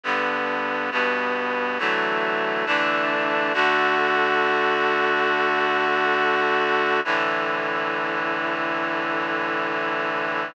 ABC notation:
X:1
M:4/4
L:1/8
Q:1/4=137
K:D
V:1 name="Clarinet"
[G,,D,B,]4 [G,,B,,B,]4 | [D,E,F,A,]4 [D,E,A,D]4 | [D,A,F]8- | [D,A,F]8 |
[A,,D,E,]8- | [A,,D,E,]8 |]